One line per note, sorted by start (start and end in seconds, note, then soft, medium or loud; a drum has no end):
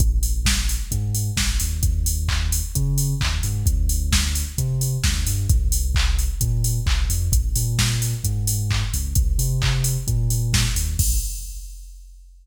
0.00 0.77 A#1 loud
0.00 kick loud
0.00 closed hi-hat loud
0.23 open hi-hat medium
0.45 kick medium
0.45 snare loud
0.69 open hi-hat medium
0.92 1.30 G#2 loud
0.92 kick medium
0.92 closed hi-hat loud
1.15 open hi-hat medium
1.37 1.57 A#1 medium
1.37 kick medium
1.37 snare loud
1.60 1.81 D#2 medium
1.60 open hi-hat medium
1.83 2.61 D#2 loud
1.83 kick loud
1.83 closed hi-hat loud
2.06 open hi-hat medium
2.28 kick medium
2.28 clap loud
2.52 open hi-hat medium
2.75 3.14 C#3 medium
2.75 kick medium
2.75 closed hi-hat loud
2.98 open hi-hat medium
3.20 3.40 D#2 medium
3.20 kick medium
3.20 clap loud
3.43 3.63 G#2 loud
3.43 open hi-hat medium
3.66 4.43 D2 loud
3.66 kick loud
3.66 closed hi-hat loud
3.89 open hi-hat medium
4.12 kick medium
4.12 snare loud
4.35 open hi-hat medium
4.58 4.97 C3 loud
4.58 kick medium
4.58 closed hi-hat loud
4.81 open hi-hat medium
5.04 5.24 D2 loud
5.04 kick medium
5.04 snare loud
5.27 5.46 G2 medium
5.27 open hi-hat medium
5.49 6.28 C2 loud
5.49 kick loud
5.49 closed hi-hat loud
5.72 open hi-hat medium
5.95 kick medium
5.95 clap loud
6.19 open hi-hat medium
6.41 6.79 A#2 medium
6.41 kick medium
6.41 closed hi-hat loud
6.64 open hi-hat medium
6.86 7.06 C2 loud
6.86 kick medium
6.86 clap loud
7.09 7.29 F2 loud
7.09 open hi-hat medium
7.32 7.52 A#1 loud
7.32 kick loud
7.32 closed hi-hat loud
7.56 8.14 A#2 loud
7.56 open hi-hat medium
7.79 kick medium
7.79 snare loud
8.02 open hi-hat medium
8.24 8.83 G#2 medium
8.24 kick medium
8.24 closed hi-hat loud
8.47 open hi-hat medium
8.71 kick medium
8.71 clap loud
8.94 9.13 C#2 loud
8.94 open hi-hat medium
9.15 9.35 C2 loud
9.15 kick loud
9.15 closed hi-hat loud
9.38 9.97 C3 loud
9.38 open hi-hat medium
9.62 kick medium
9.62 clap loud
9.84 open hi-hat medium
10.07 10.66 A#2 loud
10.07 kick medium
10.07 closed hi-hat loud
10.30 open hi-hat medium
10.53 kick medium
10.53 snare loud
10.75 10.95 D#2 medium
10.75 open hi-hat medium
10.99 11.15 A#1 loud
10.99 kick loud
10.99 crash loud